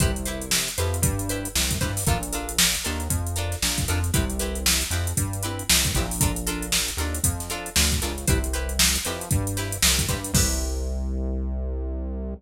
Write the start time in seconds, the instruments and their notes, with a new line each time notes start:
0.00 synth bass 1 C2, pizzicato strings E4 G4 B4 C5, kick, closed hi-hat
0.16 closed hi-hat
0.25 pizzicato strings E4 G4 B4 C5, closed hi-hat
0.41 closed hi-hat
0.51 snare
0.68 closed hi-hat
0.78 synth bass 1 F2, pizzicato strings E4 G4 B4 C5, closed hi-hat
0.94 closed hi-hat
1.02 synth bass 1 G2, kick, closed hi-hat
1.19 closed hi-hat
1.29 pizzicato strings E4 G4 B4 C5, closed hi-hat
1.45 closed hi-hat
1.55 synth bass 1 C2, snare
1.71 kick, closed hi-hat
1.81 synth bass 1 G2, pizzicato strings E4 G4 B4 C5, kick, closed hi-hat
1.97 snare, open hi-hat
2.07 synth bass 1 A#1, pizzicato strings D4 F4 A4 A#4, kick, closed hi-hat
2.23 closed hi-hat
2.33 pizzicato strings D4 F4 A4 A#4, closed hi-hat
2.49 closed hi-hat
2.59 snare
2.75 closed hi-hat
2.84 synth bass 1 D#2, pizzicato strings D4 F4 A4 A#4, closed hi-hat
3.00 closed hi-hat
3.10 synth bass 1 F2, kick, closed hi-hat
3.27 closed hi-hat
3.36 pizzicato strings D4 F4 A4 A#4, closed hi-hat
3.52 snare, closed hi-hat
3.62 synth bass 1 A#1, snare
3.78 kick, snare, closed hi-hat
3.88 synth bass 1 F2, pizzicato strings D4 F4 A4 A#4, closed hi-hat
4.04 closed hi-hat
4.14 synth bass 1 C2, pizzicato strings C4 E4 G4 B4, kick, closed hi-hat
4.30 closed hi-hat
4.39 pizzicato strings C4 E4 G4 B4, closed hi-hat
4.55 closed hi-hat
4.66 snare
4.81 closed hi-hat
4.91 synth bass 1 F2, pizzicato strings C4 E4 G4 B4, closed hi-hat
5.07 closed hi-hat
5.17 synth bass 1 G2, kick, closed hi-hat
5.33 closed hi-hat
5.43 pizzicato strings C4 E4 G4 B4, closed hi-hat
5.59 closed hi-hat
5.70 synth bass 1 C2, snare
5.85 kick, closed hi-hat
5.95 synth bass 1 A#1, pizzicato strings C4 E4 G4 B4, kick, closed hi-hat
6.11 open hi-hat
6.21 pizzicato strings D4 F4 A4 A#4, kick, closed hi-hat
6.36 closed hi-hat
6.47 pizzicato strings D4 F4 A4 A#4, closed hi-hat
6.62 closed hi-hat
6.72 snare
6.88 closed hi-hat
6.97 synth bass 1 D#2, pizzicato strings D4 F4 A4 A#4, closed hi-hat
7.14 closed hi-hat
7.24 synth bass 1 F2, kick, closed hi-hat
7.40 snare, closed hi-hat
7.50 pizzicato strings D4 F4 A4 A#4, closed hi-hat
7.66 closed hi-hat
7.76 synth bass 1 D2, snare
7.92 kick, closed hi-hat
8.02 synth bass 1 C#2, pizzicato strings D4 F4 A4 A#4, closed hi-hat
8.18 closed hi-hat
8.27 synth bass 1 C2, pizzicato strings E4 G4 B4 C5, kick, closed hi-hat
8.44 closed hi-hat
8.53 pizzicato strings E4 G4 B4 C5, closed hi-hat
8.69 closed hi-hat
8.79 snare
8.95 snare, closed hi-hat
9.05 synth bass 1 F2, pizzicato strings E4 G4 B4 C5, closed hi-hat
9.21 closed hi-hat
9.31 synth bass 1 G2, kick, closed hi-hat
9.47 closed hi-hat
9.57 pizzicato strings E4 G4 B4 C5, snare, closed hi-hat
9.72 closed hi-hat
9.82 synth bass 1 C2, snare
9.99 kick, closed hi-hat
10.09 synth bass 1 G2, pizzicato strings E4 G4 B4 C5, kick, closed hi-hat
10.24 closed hi-hat
10.34 synth bass 1 C2, pizzicato strings E4 G4 B4 C5, kick, crash